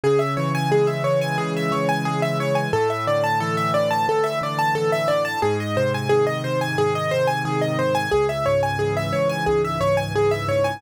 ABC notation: X:1
M:4/4
L:1/16
Q:1/4=89
K:C#m
V:1 name="Acoustic Grand Piano"
G e c g G e c g G e c g G e c g | A e =d a A e d a A e d a A e d a | G d ^B g G d B g G d B g G d B g | G e c g G e c g G e c g G e c g |]
V:2 name="Acoustic Grand Piano" clef=bass
C,2 E,2 G,2 E,2 C,2 E,2 G,2 E,2 | A,,2 =D,2 E,2 D,2 A,,2 D,2 E,2 D,2 | G,,2 ^B,,2 D,2 B,,2 G,,2 B,,2 D,2 B,,2 | C,,2 G,,2 E,2 G,,2 C,,2 G,,2 E,2 G,,2 |]